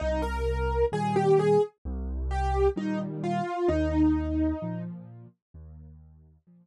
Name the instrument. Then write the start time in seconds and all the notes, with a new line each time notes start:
acoustic grand piano
0.00 C2 D#4
0.22 A#4
0.92 A#2 D#3 G3 G#4
1.16 G4
1.39 G#4
1.85 C2
2.31 G4
2.76 A#2 D#3 G3 D#4
3.24 F4
3.68 D#2 D#4
4.62 A#2 F3
5.54 D#2
6.47 A#2 F3